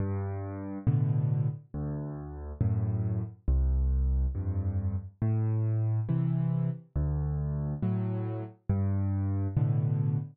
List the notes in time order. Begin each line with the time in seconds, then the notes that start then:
0.00 G2
0.87 A2 B2 D3
1.74 D2
2.61 F#2 A2
3.48 C2
4.35 F2 G2
5.22 A2
6.09 C3 E3
6.96 D2
7.82 A2 F#3
8.69 G2
9.57 A2 B2 D3